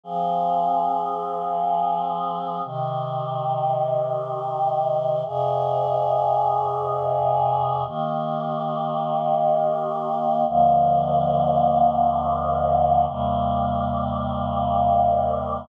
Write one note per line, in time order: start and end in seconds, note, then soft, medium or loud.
0.04 2.62 F3 medium
0.04 2.62 C4 medium
0.04 2.62 G#4 medium
2.64 5.23 C3 medium
2.64 5.23 D#3 medium
2.64 5.23 G4 medium
5.25 7.84 F2 medium
5.25 7.84 C3 medium
5.25 7.84 G#4 loud
7.86 10.44 D#3 medium
7.86 10.44 A#3 medium
7.86 10.44 G4 medium
10.47 13.06 D#2 medium
10.47 13.06 D3 medium
10.47 13.06 F3 medium
10.47 13.06 A#3 medium
13.08 15.66 D#2 medium
13.08 15.66 C3 medium
13.08 15.66 G3 medium
13.08 15.66 A#3 medium